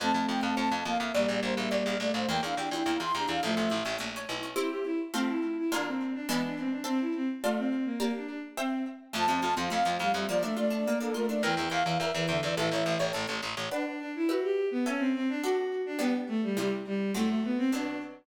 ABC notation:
X:1
M:2/2
L:1/8
Q:1/2=105
K:Dm
V:1 name="Flute"
a2 g a a2 f e | d2 c e d2 d c | g f g3 c' b f | e4 z4 |
[K:F] z8 | z8 | z8 | z8 |
[K:Dm] a3 f f2 f e | d e d3 A B d | g2 f f e2 e d | e4 z4 |
[K:Em] z8 | z8 | z8 | z8 |]
V:2 name="Violin"
[A,C]6 B,2 | [G,B,]6 A,2 | B, D D2 E2 D2 | [F,A,]2 z6 |
[K:F] E G E z C E2 E | D C2 D =B, D C D | C E C z A, C2 B, | B, D D z C2 z2 |
[K:Dm] F, F, z F, z F, G, G, | F, A, A,2 B,2 A,2 | E, E, z E, z E, D, E, | E, E,2 z5 |
[K:Em] D D D E F G2 B, | ^C =C C D F F2 D | B, z A, G, G, z G,2 | A, A, B, C D2 z2 |]
V:3 name="Harpsichord"
c f a f c f a f | d f b f d f b f | B, E G E B, E G E | A, ^C E C A, C E C |
[K:F] [CEG]4 [A,CF]4 | [D,B,F]4 [E,^G,=B,D]4 | [cea]4 [Fda]4 | [Gdb]4 [ceg]4 |
[K:Dm] A, C F C A, C F C | B, D F D B, D F D | B e g e B e g e | A ^c e c A c e c |
[K:Em] [Bdf]4 [GBe]4 | [^CAe]4 [DAf]4 | [G,B,D]4 [C,G,E]4 | [A,,F,C]4 [B,,F,D]4 |]
V:4 name="Harpsichord" clef=bass
F,, F,, F,, F,, F,, F,, F,, F,, | B,,, B,,, B,,, B,,, B,,, B,,, B,,, B,,, | E,, E,, E,, E,, E,, E,, E,, E,, | A,,, A,,, A,,, A,,, B,,,2 =B,,,2 |
[K:F] z8 | z8 | z8 | z8 |
[K:Dm] F,, F,, F,, F,, F,, F,, F,, F,, | z8 | E,, E,, E,, E,, E,, E,, E,, E,, | A,,, A,,, A,,, A,,, A,,, A,,, A,,, A,,, |
[K:Em] z8 | z8 | z8 | z8 |]